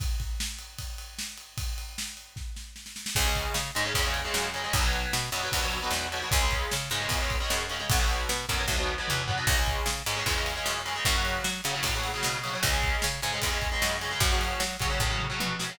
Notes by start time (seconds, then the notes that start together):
0.00 kick, ride
0.20 kick, ride
0.40 snare
0.59 ride
0.79 kick, ride
0.98 ride
1.19 snare
1.38 ride
1.58 kick, ride
1.78 ride
1.98 snare
2.17 ride
2.36 kick, snare
2.56 snare
2.76 snare
2.86 snare
2.96 snare
3.06 snare
3.15 C#2 C#3 G#3, kick, crash
3.25 C#3 G#3
3.35 kick, ride
3.54 C#3, snare
3.75 G#2 C#3 G#3, ride
3.85 C#3 G#3
3.94 E2 C#3 G#3, kick, ride
4.05 C#3 G#3
4.14 ride
4.25 C#3 G#3
4.34 F#2, snare
4.54 C#3 G#3, ride
4.64 C#3 G#3
4.73 B1 B2 F#3, kick, ride
4.83 B2 F#3
4.93 ride
5.13 B2, snare
5.32 F#2 B2 F#3, ride
5.43 B2 F#3
5.52 D2 B2 F#3, kick, ride
5.62 B2 F#3
5.72 ride
5.82 B2 F#3
5.91 E2, snare
6.12 B2 F#3, ride
6.22 B2 F#3
6.31 C#2 C#3 G#3, kick, ride
6.41 C#3 G#3
6.51 kick, ride
6.71 C#3, snare
6.90 G#2 C#3 G#3, ride
7.01 C#3 G#3
7.09 E2 C#3 G#3, kick, ride
7.20 C#3 G#3
7.30 kick, ride
7.40 C#3 G#3
7.50 F#2, snare
7.70 C#3 G#3, ride
7.80 C#3 G#3
7.89 B1 B2 F#3, kick, ride
7.99 B2 F#3
8.09 ride
8.29 B2, snare
8.49 F#2 B2 F#3, kick, ride
8.58 B2 F#3
8.68 D2 B2 F#3, kick, snare
8.78 B2 F#3
8.98 B2 F#3
9.08 E2, mid tom
9.28 B2 F#3, floor tom
9.37 B2 F#3
9.47 C#2 C#3 G#3, kick, crash
9.57 C#3 G#3
9.66 kick, ride
9.86 C#3, snare
10.06 G#2 C#3 G#3, ride
10.16 C#3 G#3
10.26 E2 C#3 G#3, kick, ride
10.36 C#3 G#3
10.46 ride
10.56 C#3 G#3
10.66 F#2, snare
10.86 C#3 G#3, ride
10.96 C#3 G#3
11.05 F#2 C#3 F#3, kick, ride
11.15 C#3 F#3
11.25 ride
11.44 F#3, snare
11.64 C#3 F#3, ride
11.74 C#3 F#3
11.83 A2 C#3 F#3, kick, ride
11.94 C#3 F#3
12.04 ride
12.14 C#3 F#3
12.23 B2, snare
12.43 C#3 F#3, ride
12.53 C#3 F#3
12.63 C#2 C#3 G#3, kick, ride
12.73 C#3 G#3
12.83 kick, ride
13.02 C#3, snare
13.22 G#2 C#3 G#3, ride
13.33 C#3 G#3
13.42 E2 C#3 G#3, kick, ride
13.52 C#3 G#3
13.62 kick, ride
13.72 C#3 G#3
13.82 F#2, snare
14.01 C#3 G#3, ride
14.11 C#3 G#3
14.20 F#2 C#3 F#3, kick, ride
14.31 C#3 F#3
14.41 ride
14.60 F#3, snare
14.80 C#3 F#3, kick, ride
14.90 C#3 F#3
15.00 A2 C#3 F#3, kick
15.10 C#3 F#3
15.20 mid tom
15.30 C#3 F#3
15.40 B2, high tom
15.59 C#3 F#3, snare
15.69 C#3 F#3